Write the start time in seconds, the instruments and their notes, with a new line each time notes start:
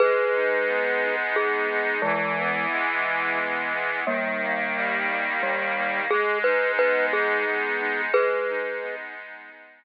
0.00 accordion G#3, glockenspiel G#4 B4
0.34 accordion D#4
0.67 accordion B3
1.02 accordion D#4
1.36 accordion G#3, glockenspiel G#4
1.69 accordion D#4
2.02 glockenspiel E3 G#3, accordion E3
2.37 accordion B3
2.71 accordion G#3
3.05 accordion B3
3.39 accordion E3
3.73 accordion B3
4.07 accordion D#3, glockenspiel G3 A#3
4.41 accordion A#3
4.76 accordion G3
5.09 accordion A#3
5.42 accordion D#3, glockenspiel G3
5.76 accordion A#3
6.10 accordion G#3, glockenspiel G#4
6.44 accordion D#4, glockenspiel B4
6.77 accordion B3, glockenspiel B4
7.12 accordion D#4, glockenspiel G#4
7.45 accordion G#3
7.79 accordion D#4
8.13 accordion G#3, glockenspiel G#4 B4
8.48 accordion D#4
8.82 accordion B3
9.15 accordion D#4
9.50 accordion G#3
9.83 accordion D#4